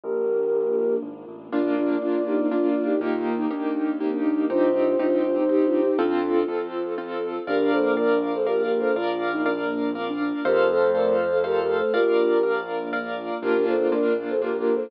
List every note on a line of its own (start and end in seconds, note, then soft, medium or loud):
0.04 0.98 A#1 medium
0.04 1.51 A#3 medium
0.04 1.51 D4 medium
0.04 1.51 F4 medium
0.04 0.96 G4 medium
0.04 0.45 A#4 medium
0.04 0.96 A#4 loud
1.03 1.25 G#1 medium
1.27 1.50 A1 medium
1.52 1.98 A#1 medium
1.52 1.97 A#3 loud
1.52 3.00 A#3 medium
1.52 1.74 D4 medium
1.52 1.97 D4 loud
1.52 3.00 D4 medium
1.52 1.74 F4 medium
1.52 1.97 F4 loud
1.52 3.00 F4 medium
1.52 2.96 D5 medium
1.77 1.97 D4 medium
1.77 1.97 F4 medium
2.01 2.93 A#1 medium
2.01 2.46 A#3 medium
2.01 2.22 D4 medium
2.01 2.46 D4 medium
2.01 2.22 F4 medium
2.01 2.46 F4 medium
2.26 2.38 D#4 medium
2.26 2.38 G4 medium
2.39 2.51 C4 medium
2.39 2.51 D#4 medium
2.51 2.96 A#3 medium
2.51 2.67 D4 medium
2.51 2.96 D4 medium
2.51 2.67 F4 medium
2.51 2.96 F4 medium
2.68 2.83 D4 medium
2.68 2.83 F4 medium
2.84 3.00 D#4 medium
2.84 3.00 G4 medium
3.01 3.47 D#2 medium
3.01 4.48 A#3 medium
3.01 3.46 A#3 loud
3.01 4.48 D#4 medium
3.01 3.46 D#4 loud
3.01 3.34 F4 medium
3.01 4.48 G4 medium
3.01 3.46 G4 loud
3.38 3.49 D#4 medium
3.51 4.42 D#2 medium
3.51 3.95 A#3 medium
3.51 3.95 D4 medium
3.51 3.95 D#4 medium
3.51 3.95 G4 medium
4.00 4.45 A#3 medium
4.00 4.11 C4 medium
4.00 4.45 D#4 medium
4.00 4.45 G4 medium
4.12 4.23 D4 medium
4.25 4.47 D4 medium
4.50 4.95 C2 medium
4.50 4.94 C4 loud
4.50 5.97 C4 medium
4.50 4.72 D4 loud
4.50 4.94 D#4 loud
4.50 5.97 D#4 medium
4.50 4.72 F4 loud
4.50 4.94 G4 loud
4.50 5.97 G4 loud
4.50 5.92 C5 medium
4.75 4.96 D4 medium
4.75 4.96 F4 medium
4.99 5.90 C2 medium
4.99 5.44 C4 medium
4.99 5.21 D4 medium
4.99 5.44 D#4 loud
4.99 5.21 F4 medium
4.99 5.44 G4 loud
5.24 5.36 D4 medium
5.24 5.36 F4 medium
5.36 5.48 C4 medium
5.36 5.48 D#4 medium
5.49 5.94 C4 loud
5.49 5.94 D#4 medium
5.49 5.65 D#4 medium
5.49 5.94 G4 medium
5.49 5.65 G4 medium
5.65 5.81 D4 medium
5.65 5.81 F4 medium
5.82 5.97 D#4 medium
5.82 5.97 G4 medium
5.98 6.44 F2 medium
5.98 6.43 C4 loud
5.98 7.46 C4 medium
5.98 6.45 D4 medium
5.98 6.43 F4 loud
5.98 6.67 F4 medium
5.98 6.45 F4 medium
5.98 7.46 F4 medium
5.98 6.43 A4 loud
5.98 7.46 A4 loud
6.48 7.39 F2 medium
6.48 6.93 C4 medium
6.48 6.93 F4 medium
6.48 6.93 A4 medium
6.98 7.42 C4 medium
6.98 7.42 F4 medium
6.98 7.42 A4 loud
7.47 8.84 A#1 loud
7.47 8.94 A#3 medium
7.47 8.94 D4 medium
7.47 8.32 D4 medium
7.47 8.94 F4 medium
7.47 7.71 G4 medium
7.47 7.92 A#4 loud
7.47 7.71 A#4 loud
7.47 7.92 D5 loud
7.47 7.92 F5 loud
7.72 7.94 A4 medium
7.72 7.94 C5 medium
7.97 8.18 A#4 medium
7.97 8.41 A#4 medium
7.97 8.18 D5 medium
7.97 8.41 D5 medium
7.97 8.41 F5 medium
8.34 8.46 A4 medium
8.34 8.46 C5 medium
8.46 8.62 G4 medium
8.46 8.62 A#4 medium
8.46 8.91 A#4 loud
8.46 8.91 D5 medium
8.46 8.91 F5 medium
8.63 8.79 G4 medium
8.63 8.79 A#4 medium
8.79 8.95 A4 medium
8.79 8.95 C5 medium
8.96 10.33 A#1 medium
8.96 10.43 A#3 medium
8.96 10.43 D4 medium
8.96 10.43 F4 medium
8.96 9.30 F4 medium
8.96 9.41 A#4 loud
8.96 9.41 D5 loud
8.96 9.41 F5 loud
9.33 9.44 D#4 medium
9.46 9.90 D4 medium
9.46 9.90 A#4 medium
9.46 9.90 D5 medium
9.46 9.90 F5 medium
9.95 10.07 C4 medium
9.95 10.40 A#4 loud
9.95 10.40 D5 medium
9.95 10.40 F5 loud
10.08 10.19 D4 medium
10.20 10.42 D4 medium
10.45 11.82 F2 loud
10.45 11.92 A3 medium
10.45 11.92 C4 medium
10.45 11.92 F4 medium
10.45 10.68 G4 medium
10.45 10.90 A4 loud
10.45 10.68 A#4 loud
10.45 10.90 C5 loud
10.45 11.40 C5 medium
10.45 10.90 F5 loud
10.70 10.90 A4 medium
10.70 10.90 C5 loud
10.94 11.39 A4 medium
10.94 11.15 A#4 medium
10.94 11.39 C5 medium
10.94 11.15 D5 medium
10.94 11.39 F5 medium
11.32 11.43 A4 medium
11.32 11.43 C5 medium
11.44 11.60 G4 medium
11.44 11.89 A4 loud
11.44 11.60 A#4 medium
11.44 11.89 C5 medium
11.44 11.89 F5 loud
11.61 11.76 G4 medium
11.61 11.76 A#4 medium
11.77 11.93 A4 medium
11.77 11.93 C5 medium
11.93 13.31 A#1 medium
11.93 13.41 A#3 medium
11.93 13.41 D4 medium
11.93 12.38 F4 medium
11.93 13.41 F4 medium
11.93 12.58 G4 medium
11.93 12.38 A#4 loud
11.93 12.58 A#4 medium
11.93 12.38 D5 loud
11.93 12.38 F5 loud
12.43 12.88 A#4 loud
12.43 12.88 D5 medium
12.43 12.88 F5 medium
12.93 13.37 A#4 loud
12.93 13.37 D5 loud
12.93 13.37 F5 medium
13.42 14.79 A#1 medium
13.42 13.87 A#3 loud
13.42 14.90 A#3 medium
13.42 13.87 D4 loud
13.42 14.06 D4 medium
13.42 14.90 D4 medium
13.42 13.87 F4 loud
13.42 14.90 F4 medium
13.42 13.66 G4 medium
13.42 13.66 A#4 loud
13.67 13.91 A4 medium
13.67 13.91 C5 medium
13.92 14.36 A#3 loud
13.92 14.36 D4 loud
13.92 14.36 F4 loud
13.92 14.14 A#4 medium
13.92 14.14 D5 medium
14.29 14.41 A4 medium
14.29 14.41 C5 medium
14.41 14.86 A#3 loud
14.41 14.86 D4 loud
14.41 14.86 F4 medium
14.41 14.57 G4 medium
14.41 14.57 A#4 medium
14.58 14.74 G4 medium
14.58 14.74 A#4 medium
14.75 14.90 A4 medium
14.75 14.90 C5 medium